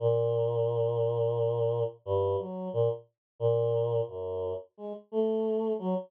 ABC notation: X:1
M:3/4
L:1/16
Q:1/4=88
K:none
V:1 name="Choir Aahs"
_B,,12 | G,,2 _G,2 _B,, z3 B,,4 | _G,,3 z _A, z =A,4 _G, z |]